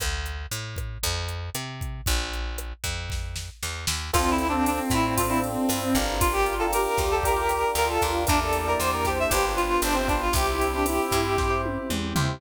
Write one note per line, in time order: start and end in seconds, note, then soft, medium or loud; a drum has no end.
0.00 0.46 D2 medium
0.00 kick medium
0.00 cross-stick loud
0.00 closed hi-hat loud
0.26 closed hi-hat medium
0.51 0.98 A2 medium
0.51 closed hi-hat loud
0.76 kick medium
0.76 cross-stick medium
0.76 closed hi-hat medium
1.03 1.50 F2 medium
1.03 kick medium
1.03 closed hi-hat loud
1.28 closed hi-hat medium
1.55 2.01 C3 medium
1.55 cross-stick medium
1.55 closed hi-hat loud
1.81 kick medium
1.81 closed hi-hat medium
2.06 2.73 A#1 medium
2.06 kick loud
2.06 closed hi-hat medium
2.33 closed hi-hat medium
2.58 cross-stick medium
2.58 closed hi-hat loud
2.84 3.50 F2 medium
2.84 kick medium
2.84 closed hi-hat medium
3.10 kick medium
3.10 snare medium
3.36 snare medium
3.63 3.86 E2 medium
3.63 snare medium
3.87 4.11 D#2 medium
3.87 snare loud
4.13 4.80 D2 medium
4.13 4.44 C4 medium
4.13 5.98 C4 loud
4.13 4.44 D4 medium
4.13 4.30 F4 medium
4.13 4.44 F4 medium
4.13 4.44 A4 medium
4.13 6.19 C5 medium
4.13 6.19 D5 medium
4.13 6.19 F5 medium
4.13 6.19 A5 medium
4.13 kick medium
4.13 cross-stick loud
4.13 crash loud
4.31 4.47 E4 medium
4.38 ride medium
4.48 4.93 C4 medium
4.48 4.65 D4 medium
4.48 4.93 D4 medium
4.48 4.93 F4 medium
4.48 4.93 A4 medium
4.66 4.79 D4 medium
4.66 ride loud
4.90 5.57 A2 medium
4.90 5.14 E4 medium
4.90 kick medium
4.90 snare medium
4.90 ride medium
5.17 5.28 C4 medium
5.17 5.28 D4 medium
5.17 5.29 F4 medium
5.17 5.28 F4 medium
5.17 5.28 A4 medium
5.17 kick medium
5.17 ride loud
5.29 5.71 C4 medium
5.29 5.71 D4 medium
5.29 5.41 E4 medium
5.29 5.71 F4 medium
5.29 5.71 A4 medium
5.44 ride medium
5.69 5.94 G2 medium
5.69 cross-stick medium
5.69 ride loud
5.95 6.87 G1 medium
5.95 6.53 D4 medium
5.95 6.53 F4 medium
5.95 6.53 G4 medium
5.95 6.53 A#4 loud
5.95 kick medium
5.95 ride medium
6.20 6.32 F4 medium
6.20 6.67 F4 medium
6.20 8.26 D5 medium
6.20 8.26 F5 medium
6.20 8.26 G5 medium
6.20 8.26 A#5 medium
6.20 kick loud
6.20 ride loud
6.33 6.54 G4 medium
6.46 ride medium
6.59 7.01 D4 medium
6.59 7.01 F4 medium
6.59 7.01 G4 medium
6.59 6.71 A4 medium
6.59 7.01 A#4 medium
6.72 7.65 G4 loud
6.72 7.04 A#4 medium
6.72 cross-stick medium
6.72 ride loud
6.97 7.64 D2 medium
6.97 kick medium
6.97 snare medium
6.97 ride medium
7.11 7.23 A4 medium
7.23 7.35 D4 medium
7.23 7.35 F4 medium
7.23 7.35 G4 medium
7.23 7.35 A#4 medium
7.23 7.72 A#4 medium
7.23 kick medium
7.23 ride loud
7.36 7.78 D4 medium
7.36 7.78 F4 medium
7.36 7.78 G4 medium
7.36 7.78 A#4 medium
7.49 cross-stick medium
7.49 ride medium
7.75 7.98 D2 medium
7.75 8.23 F4 medium
7.75 7.88 A#4 medium
7.75 ride medium
7.89 8.11 A4 medium
8.01 8.26 D#2 medium
8.01 8.23 D4 medium
8.01 8.23 F4 medium
8.01 8.23 G4 medium
8.01 8.23 A#4 medium
8.01 kick medium
8.01 ride medium
8.27 8.76 E2 medium
8.27 9.30 A#3 medium
8.27 8.40 D4 medium
8.27 9.30 D4 medium
8.27 8.59 D4 medium
8.27 9.30 E4 medium
8.27 8.59 E4 loud
8.27 9.30 G4 medium
8.27 8.59 G4 medium
8.27 8.59 A#4 medium
8.27 9.01 D5 loud
8.27 kick loud
8.27 cross-stick medium
8.27 ride loud
8.41 8.66 A4 medium
8.53 ride medium
8.67 9.08 D4 medium
8.67 9.08 E4 medium
8.67 9.08 G4 medium
8.67 9.08 A#4 medium
8.67 8.80 A#4 medium
8.79 9.26 E2 medium
8.79 8.91 C5 medium
8.79 ride loud
8.93 9.06 A#4 medium
9.05 9.18 G4 medium
9.05 9.77 C5 medium
9.05 kick medium
9.05 snare medium
9.05 ride medium
9.19 9.32 E5 medium
9.30 9.78 G1 medium
9.30 10.34 B3 medium
9.30 10.34 D4 medium
9.30 9.43 D4 medium
9.30 10.34 F4 medium
9.30 9.43 F4 loud
9.30 9.52 G4 medium
9.30 10.34 G4 medium
9.30 9.43 G4 medium
9.30 9.43 B4 medium
9.30 kick medium
9.30 ride loud
9.44 9.85 D4 medium
9.44 9.85 F4 medium
9.44 9.85 G4 medium
9.44 9.85 B4 medium
9.57 9.81 F4 medium
9.57 ride medium
9.82 10.29 G1 medium
9.82 9.95 D4 medium
9.82 10.25 C5 medium
9.82 cross-stick medium
9.82 ride loud
9.94 10.07 C4 medium
10.08 10.28 D4 medium
10.08 10.20 D4 medium
10.08 10.28 F4 medium
10.08 10.28 G4 medium
10.08 10.28 B4 medium
10.08 kick medium
10.08 ride medium
10.21 10.34 F4 medium
10.33 10.99 C2 medium
10.33 12.39 C4 medium
10.33 12.39 E4 medium
10.33 10.66 E4 loud
10.33 10.46 G4 loud
10.33 12.39 G4 medium
10.33 11.61 G4 medium
10.33 10.66 G4 loud
10.33 10.66 C5 medium
10.33 kick loud
10.33 ride loud
10.48 10.72 E4 medium
10.61 ride medium
10.73 10.86 D4 loud
10.73 11.15 E4 medium
10.73 11.15 G4 medium
10.73 11.15 C5 medium
10.86 11.36 E4 medium
10.86 cross-stick medium
10.86 ride loud
11.11 11.78 G2 medium
11.11 kick medium
11.11 snare medium
11.11 ride medium
11.38 11.48 E4 medium
11.38 11.48 G4 medium
11.38 11.62 G4 medium
11.38 11.48 C5 medium
11.38 kick loud
11.38 snare medium
11.50 11.92 E4 medium
11.50 11.92 G4 medium
11.50 11.92 C5 medium
11.65 high tom medium
11.90 12.13 E2 medium
11.90 mid tom loud
12.16 12.39 D#2 medium
12.16 12.36 E4 medium
12.16 12.36 G4 medium
12.16 12.36 C5 medium
12.16 floor tom loud